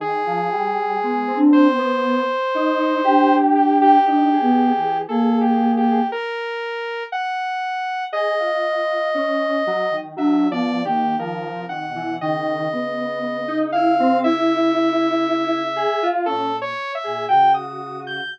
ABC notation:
X:1
M:6/4
L:1/16
Q:1/4=59
K:none
V:1 name="Ocarina"
z4 (3B,2 D2 B,2 z4 D4 (3D2 B,2 E,2 ^A,4 | z16 (3D2 B,2 ^A,2 (3^D,2 C,2 B,,2 | ^C,16 ^A,,2 z A,, C,4 |]
V:2 name="Lead 1 (square)"
^D, F, G,2 ^G, C2 B,2 z ^D2 =G4 D ^G3 G4 | z8 ^G F3 ^C2 ^F, ^D, (3F,2 =F,2 D,2 F,2 D, E, | ^D,2 B,3 ^D E C E6 ^G F ^C z2 G ^F4 |]
V:3 name="Lead 2 (sawtooth)"
^G6 c8 =G G G4 (3A2 G2 G2 | ^A4 ^f4 ^d8 (3e2 =d2 G2 A2 f2 | ^d6 f2 e8 (3A2 ^c2 e2 g ^d'2 g' |]